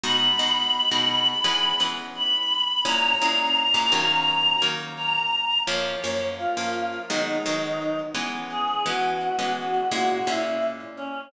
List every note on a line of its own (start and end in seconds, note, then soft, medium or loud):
0.04 0.32 B2 loud
0.04 0.32 G#3 loud
0.04 0.32 D#4 loud
0.04 0.32 F#4 loud
0.04 1.81 B5 loud
0.39 0.81 B2 medium
0.39 0.81 G#3 medium
0.39 0.81 D#4 medium
0.39 0.81 F#4 medium
0.91 1.34 B2 medium
0.91 1.34 G#3 medium
0.91 1.34 D#4 medium
0.91 1.34 F#4 medium
1.44 1.72 E3 loud
1.44 1.72 G#3 loud
1.44 1.72 B3 medium
1.44 1.72 C#4 loud
1.80 2.36 E3 medium
1.80 2.36 G#3 medium
1.80 2.36 B3 medium
1.80 2.36 C#4 medium
2.16 2.84 B5 loud
2.85 3.13 A#2 loud
2.85 3.13 G#3 medium
2.85 3.13 C#4 loud
2.85 3.13 E4 loud
2.85 4.64 A#5 loud
3.22 3.64 A#2 medium
3.22 3.64 G#3 medium
3.22 3.64 C#4 medium
3.22 3.64 E4 medium
3.74 3.91 A#2 loud
3.74 3.91 G#3 medium
3.74 3.91 C#4 medium
3.74 3.91 E4 medium
3.92 4.55 D#3 loud
3.92 4.55 F#3 loud
3.92 4.55 A#3 loud
3.92 4.55 C#4 loud
4.62 5.18 D#3 medium
4.62 5.18 F#3 medium
4.62 5.18 A#3 medium
4.62 5.18 C#4 medium
4.97 5.58 A#5 loud
5.67 5.95 F#2 loud
5.67 5.95 F3 loud
5.67 5.95 A#3 loud
5.67 5.95 C#4 loud
5.67 6.26 C#5 loud
6.04 6.46 F#2 medium
6.04 6.46 F3 medium
6.04 6.46 A#3 medium
6.04 6.46 C#4 medium
6.38 6.99 F4 loud
6.57 6.99 F#2 medium
6.57 6.99 F3 medium
6.57 6.99 A#3 medium
6.57 6.99 C#4 medium
7.10 7.38 D#3 loud
7.10 7.38 F#3 loud
7.10 7.38 G#3 loud
7.10 7.38 B3 loud
7.10 7.99 D#4 medium
7.46 8.02 D#3 medium
7.46 8.02 F#3 medium
7.46 8.02 G#3 medium
7.46 8.02 B3 medium
8.15 8.78 E3 loud
8.15 8.78 G#3 loud
8.15 8.78 B3 loud
8.15 8.78 C#4 medium
8.51 8.82 G#4 loud
8.86 9.28 E3 medium
8.86 9.28 G#3 medium
8.86 9.28 B3 loud
8.86 9.28 C#4 medium
8.86 9.50 F#4 medium
9.39 9.81 E3 medium
9.39 9.81 G#3 medium
9.39 9.81 B3 medium
9.39 9.81 C#4 medium
9.56 9.87 F#4 loud
9.90 10.20 A#2 loud
9.90 10.20 G#3 loud
9.90 10.20 C#4 loud
9.90 10.20 E4 medium
9.90 10.07 F#4 loud
10.09 10.26 F#4 loud
10.27 10.84 A#2 medium
10.27 10.84 G#3 medium
10.27 10.84 C#4 medium
10.27 10.84 E4 medium
10.27 10.62 E4 loud
10.97 11.25 C#4 loud